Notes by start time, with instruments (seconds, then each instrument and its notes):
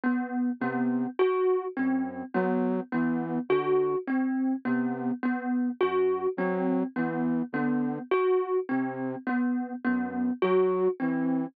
0.04 kalimba B3
0.60 flute C3, kalimba B3
1.19 kalimba F#4
1.77 flute F#2, kalimba C4
2.34 flute F#3, kalimba B3
2.92 flute E3, kalimba B3
3.49 flute D3, kalimba F#4
4.07 kalimba C4
4.65 flute C3, kalimba B3
5.23 kalimba B3
5.81 flute F#2, kalimba F#4
6.37 flute F#3, kalimba C4
6.96 flute E3, kalimba B3
7.53 flute D3, kalimba B3
8.11 kalimba F#4
8.69 flute C3, kalimba C4
9.27 kalimba B3
9.84 flute F#2, kalimba B3
10.42 flute F#3, kalimba F#4
11.00 flute E3, kalimba C4